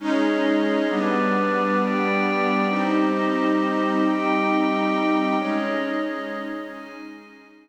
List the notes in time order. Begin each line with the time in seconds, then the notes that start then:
0.00 G#3 C#4 D#4 G#4 C#5 D#5
0.89 G3 B3 D4 G4 B4 D5
1.81 G4 D5 G5
2.68 G3 C4 D#4 G4 C5 D#5
4.03 G4 D#5 G5
5.37 G#3 C#4 D#4 G#4 C#5 D#5
6.70 G#4 D#5 G#5